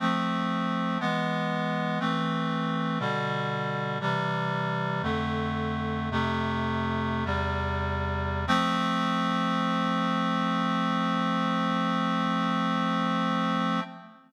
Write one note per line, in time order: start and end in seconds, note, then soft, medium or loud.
0.00 0.98 F3 medium
0.00 0.98 A3 medium
0.00 0.98 C4 medium
1.00 1.99 E3 medium
1.00 1.99 G#3 medium
1.00 1.99 B3 medium
2.00 2.99 E3 medium
2.00 2.99 A3 medium
2.00 2.99 C4 medium
3.00 3.99 B2 medium
3.00 3.99 D3 medium
3.00 3.99 G3 medium
4.01 5.02 C3 medium
4.01 5.02 E3 medium
4.01 5.02 G3 medium
5.03 6.10 F2 medium
5.03 6.10 D3 medium
5.03 6.10 A3 medium
6.11 7.24 F2 medium
6.11 7.24 C3 medium
6.11 7.24 A3 medium
7.25 8.45 E2 medium
7.25 8.45 C3 medium
7.25 8.45 G3 medium
8.47 13.80 F3 loud
8.47 13.80 A3 loud
8.47 13.80 C4 loud